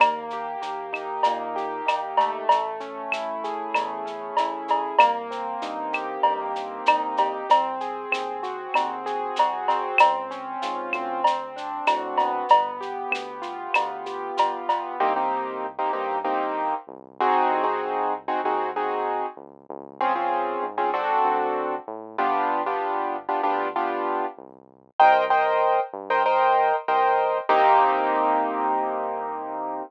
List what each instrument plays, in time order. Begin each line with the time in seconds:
0.00 synth bass 1 D#2, acoustic grand piano A#3, cowbell, claves, shaker
0.30 acoustic grand piano G4, shaker
0.62 synth bass 1 D#2, acoustic grand piano A#3, shaker
0.93 acoustic grand piano D#4, claves, shaker
1.23 synth bass 1 A#2, acoustic grand piano A#3, cowbell, shaker
1.56 acoustic grand piano G4, shaker
1.86 synth bass 1 D#2, acoustic grand piano D#4, cowbell, claves, shaker
2.17 acoustic grand piano A3, cowbell, shaker
2.49 synth bass 1 A1, cowbell, shaker
2.80 acoustic grand piano C#4, shaker
3.12 synth bass 1 A1, acoustic grand piano E4, claves, shaker
3.44 acoustic grand piano G#4, shaker
3.74 synth bass 1 E2, acoustic grand piano A3, cowbell, claves, shaker
4.06 acoustic grand piano C#4, shaker
4.37 synth bass 1 A1, acoustic grand piano E4, cowbell, shaker
4.68 acoustic grand piano G#4, cowbell, shaker
4.99 synth bass 1 C2, acoustic grand piano A#3, cowbell, claves, shaker
5.31 acoustic grand piano C4, shaker
5.62 synth bass 1 G2, acoustic grand piano D#4, shaker
5.93 acoustic grand piano G4, claves, shaker
6.23 synth bass 1 G2, acoustic grand piano A#3, cowbell
6.56 acoustic grand piano C4, shaker
6.86 synth bass 1 C2, acoustic grand piano D#4, cowbell, claves, shaker
7.17 acoustic grand piano G4, cowbell, shaker
7.49 synth bass 1 C2, acoustic grand piano C4, cowbell, shaker
7.80 acoustic grand piano G#4, shaker
8.12 synth bass 1 D#2, acoustic grand piano C4, claves, shaker
8.43 acoustic grand piano F#4, shaker
8.74 synth bass 1 D#2, acoustic grand piano C4, cowbell, claves, shaker
9.06 acoustic grand piano G#4, shaker
9.36 synth bass 1 C2, acoustic grand piano F#4, cowbell, shaker
9.68 acoustic grand piano C4, cowbell, shaker
9.98 synth bass 1 C#2, cowbell, claves, shaker
10.31 acoustic grand piano C#4, shaker
10.62 synth bass 1 G#2, acoustic grand piano F4, shaker
10.93 synth bass 1 D2, acoustic grand piano C4, claves, shaker
11.24 cowbell, shaker
11.56 acoustic grand piano D4, shaker
11.87 synth bass 1 A2, acoustic grand piano F#4, cowbell, claves, shaker
12.17 acoustic grand piano B3, cowbell, shaker
12.49 synth bass 1 G1, cowbell, shaker
12.81 acoustic grand piano G4, shaker
13.11 synth bass 1 D2, acoustic grand piano B3, claves, shaker
13.42 acoustic grand piano F4, shaker
13.74 synth bass 1 D2, acoustic grand piano B3, cowbell, claves, shaker
14.06 acoustic grand piano G4, shaker
14.37 synth bass 1 G1, acoustic grand piano F4, cowbell, shaker
14.69 acoustic grand piano B3, cowbell, shaker
15.00 synth bass 1 C2, acoustic grand piano A#3 C4 D#4 G4
15.16 acoustic grand piano A#3 C4 D#4 G4
15.79 acoustic grand piano A#3 C4 D#4 G4
15.93 synth bass 1 G2, acoustic grand piano A#3 C4 D#4 G4
16.24 acoustic grand piano A#3 C4 D#4 G4
16.87 synth bass 1 C2
17.20 acoustic grand piano C4 D#4 F#4 G#4
17.51 synth bass 1 C2
17.64 acoustic grand piano C4 D#4 F#4 G#4
18.28 acoustic grand piano C4 D#4 F#4 G#4
18.44 synth bass 1 D#2, acoustic grand piano C4 D#4 F#4 G#4
18.76 acoustic grand piano C4 D#4 F#4 G#4
19.37 synth bass 1 C#2
19.69 synth bass 1 C#2
20.01 acoustic grand piano C4 C#4 F4 G#4
20.15 acoustic grand piano C4 C#4 F4 G#4
20.62 synth bass 1 G#2
20.78 acoustic grand piano C4 C#4 F4 G#4
20.94 acoustic grand piano C4 D4 F#4 A4
21.24 synth bass 1 D2
21.87 synth bass 1 A2
22.18 synth bass 1 G1, acoustic grand piano B3 D4 F4 G4
22.66 acoustic grand piano B3 D4 F4 G4
23.29 acoustic grand piano B3 D4 F4 G4
23.43 synth bass 1 D2, acoustic grand piano B3 D4 F4 G4
23.76 acoustic grand piano B3 D4 F4 G4
24.37 synth bass 1 C2
24.99 synth bass 1 C2, acoustic grand piano A#4 C5 D#5 G5
25.30 acoustic grand piano A#4 C5 D#5 G5
25.93 synth bass 1 G2
26.10 acoustic grand piano A#4 C5 D#5 G5
26.26 acoustic grand piano A#4 C5 D#5 G5
26.88 synth bass 1 C2, acoustic grand piano A#4 C5 D#5 G5
27.49 synth bass 1 C2, acoustic grand piano A#3 C4 D#4 G4